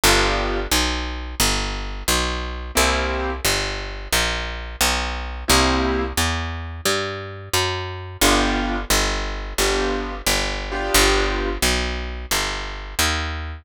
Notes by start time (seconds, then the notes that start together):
0.04 G1 B3 D4 F4 G4
0.72 B1
1.40 G1
2.08 B1
2.75 C2 A#3 C4 E4 G4
3.45 G1
4.12 A#1
4.81 B1
5.48 C2 A#3 C4 E4 G4
6.17 E2
6.86 G2
7.54 F#2
8.21 G1 B3 D4 F4 G4
8.90 G1
9.58 G1 B3 D4 F4 G4
10.27 G1
10.72 B3 D4 F4 G4
10.94 G1
11.62 B1
12.31 G1
12.99 D#2